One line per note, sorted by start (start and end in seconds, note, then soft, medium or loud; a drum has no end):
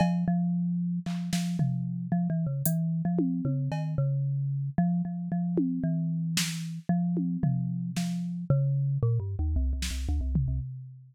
0.00 0.25 F3 loud
0.00 cowbell loud
0.28 0.99 F3 loud
1.06 1.30 F3 medium
1.06 clap medium
1.33 1.57 F3 medium
1.33 snare medium
1.59 2.07 F3 medium
1.59 floor tom loud
2.12 2.28 F3 medium
2.30 2.46 E3 medium
2.47 2.62 C#3 medium
2.65 3.02 E3 medium
2.65 closed hi-hat loud
3.05 3.41 F3 medium
3.19 high tom loud
3.45 3.69 C#3 medium
3.45 high tom medium
3.72 3.95 D#3 medium
3.72 cowbell medium
3.98 4.70 C#3 medium
4.78 5.02 F3 loud
5.05 5.29 F3 medium
5.32 5.80 F3 medium
5.58 high tom loud
5.84 6.79 E3 medium
6.37 snare loud
6.89 7.37 F3 medium
7.17 high tom medium
7.43 7.91 F3 medium
7.43 floor tom loud
7.96 8.45 F3 medium
7.96 snare medium
8.50 8.98 C#3 loud
9.03 9.19 A#2 loud
9.20 9.36 G2 medium
9.39 9.55 D#2 medium
9.56 9.72 C2 medium
9.73 9.89 C2 medium
9.82 snare medium
9.91 10.07 C2 soft
10.09 10.21 D2 medium
10.21 10.45 C2 medium
10.35 floor tom loud
10.48 10.60 C2 medium